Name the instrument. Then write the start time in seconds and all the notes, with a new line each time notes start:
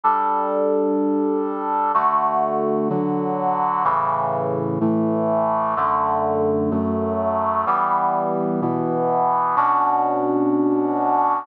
brass section
0.03 G3 D4 A4
1.94 D3 A3 F#4
2.89 D3 F#3 F#4
3.84 A2 C#3 E3
4.81 A2 E3 A3
5.76 F#2 D3 A3
6.71 F#2 F#3 A3
7.66 E3 G3 B3
8.61 B2 E3 B3
9.56 B2 C#4 D4 F#4